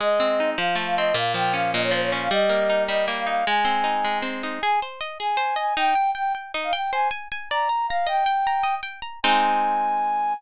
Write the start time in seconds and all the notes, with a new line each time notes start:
0.00 G#3 D#5
0.20 C4
0.40 D#4
0.57 F3 F5
0.75 A3
0.86 F5
0.96 C4 D#5
1.14 A#2 F5
1.34 F3 G5
1.54 C#4 F5
1.73 A#2 D#5
1.83 C#5
1.91 F3 C5
2.02 C#5
2.12 C#4
2.21 F5
2.31 G3 D#5
2.49 A#3
2.70 D#4
2.88 G3 D#5
3.08 A#3
3.17 F5
3.27 D#4 F5
3.46 G#3 G#5
3.65 C4
3.84 D#4
4.04 G#3
4.22 C4
4.43 D#4
4.62 G#4 G#5
4.82 C5
5.01 D#5
5.19 G#4 G#5
5.37 C5
5.56 D#5 G#5
5.77 D#4 G5
5.95 G5
6.15 G5
6.35 G5
6.54 D#4
6.64 F5
6.73 G5
6.92 C5 G#5
7.11 G#5
7.32 G#5
7.50 D5 A#5
7.69 A#5
7.88 F5 A#5
8.07 D#5 G5
8.26 G5
8.47 A#5
8.63 D#5
8.83 G5
9.02 A#5
9.23 G#3 C4 D#4 G#5